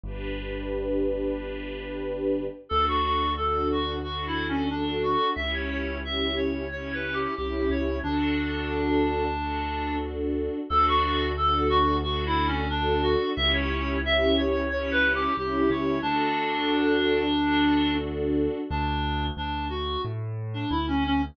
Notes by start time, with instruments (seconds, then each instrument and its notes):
0.03 acoustic grand piano G1, string ensemble 1 D4 G4 B4
2.69 acoustic grand piano D2, string ensemble 1 D4 F#4 A4, clarinet A4
2.88 clarinet F#4
3.05 clarinet F#4
3.37 string ensemble 1 D4 F#4 A4, clarinet A4
3.72 clarinet F#4
4.03 string ensemble 1 D4 F#4 A4, clarinet F#4
4.27 clarinet E4
4.48 clarinet C#4
4.70 clarinet D4, string ensemble 1 D4 F#4 A4
5.03 clarinet F#4
5.35 acoustic grand piano C#2, string ensemble 1 C#4 E4 G4, clarinet E5
5.54 clarinet C#5
5.70 clarinet C#5
6.04 string ensemble 1 C#4 E4 G4, clarinet E5
6.36 clarinet C#5
6.71 string ensemble 1 C#4 E4 G4, clarinet C#5
6.93 clarinet B4
7.13 clarinet G4
7.37 acoustic grand piano C2, string ensemble 1 C#4 E4 G4, clarinet G4
7.70 acoustic grand piano C#2, clarinet C#5
8.03 acoustic grand piano D2, clarinet D4, string ensemble 1 D4 F#4 A4
9.37 string ensemble 1 D4 F#4 A4
10.69 acoustic grand piano D2, string ensemble 1 D4 F#4 A4, clarinet A4
10.88 clarinet F#4
11.04 clarinet F#4
11.37 string ensemble 1 D4 F#4 A4, clarinet A4
11.69 clarinet F#4
12.03 string ensemble 1 D4 F#4 A4, clarinet F#4
12.26 clarinet E4
12.47 clarinet C#4
12.70 clarinet D4, string ensemble 1 D4 F#4 A4
13.03 clarinet F#4
13.36 acoustic grand piano C#2, string ensemble 1 C#4 E4 G4, clarinet E5
13.53 clarinet C#5
13.70 clarinet C#5
14.04 string ensemble 1 C#4 E4 G4, clarinet E5
14.38 clarinet C#5
14.70 string ensemble 1 C#4 E4 G4, clarinet C#5
14.91 clarinet B4
15.15 clarinet G4
15.37 acoustic grand piano C2, string ensemble 1 C#4 E4 G4, clarinet G4
15.70 acoustic grand piano C#2, clarinet C#5
16.02 acoustic grand piano D2, clarinet D4, string ensemble 1 D4 F#4 A4
17.38 string ensemble 1 D4 F#4 A4
18.70 acoustic grand piano D2, clarinet D4
19.37 acoustic grand piano D2, clarinet D4
19.69 clarinet F#4
20.05 acoustic grand piano A2
20.54 clarinet D4
20.70 acoustic grand piano D2, clarinet E4
20.88 clarinet C#4
21.06 clarinet C#4